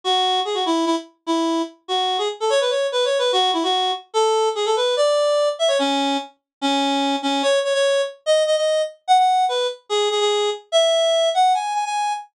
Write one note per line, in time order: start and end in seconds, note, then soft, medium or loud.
0.04 0.40 F#4 loud
0.45 0.55 G#4 medium
0.54 0.64 F#4 medium
0.66 0.85 E4 medium
0.86 0.95 E4 medium
1.27 1.62 E4 medium
1.88 2.17 F#4 medium
2.18 2.28 G#4 medium
2.40 2.50 A4 medium
2.50 2.60 C#5 loud
2.61 2.71 B4 medium
2.70 2.87 C#5 medium
2.92 3.05 B4 medium
3.05 3.18 C#5 medium
3.19 3.32 B4 medium
3.32 3.51 F#4 loud
3.53 3.63 E4 medium
3.63 3.91 F#4 medium
4.14 4.49 A4 loud
4.55 4.65 G#4 medium
4.66 4.75 A4 medium
4.76 4.95 B4 medium
4.97 5.49 D5 loud
5.59 5.69 E5 loud
5.68 5.78 C#5 loud
5.79 6.17 C#4 loud
6.61 7.16 C#4 loud
7.22 7.42 C#4 loud
7.43 7.59 C#5 loud
7.64 7.73 C#5 medium
7.74 8.01 C#5 loud
8.26 8.43 D#5 loud
8.46 8.56 D#5 loud
8.56 8.82 D#5 medium
9.08 9.17 F#5 loud
9.18 9.45 F#5 loud
9.49 9.67 B4 medium
9.89 10.09 G#4 loud
10.10 10.20 G#4 medium
10.20 10.50 G#4 medium
10.72 11.29 E5 loud
11.34 11.53 F#5 loud
11.54 11.73 G#5 loud
11.74 11.84 G#5 medium
11.85 12.13 G#5 loud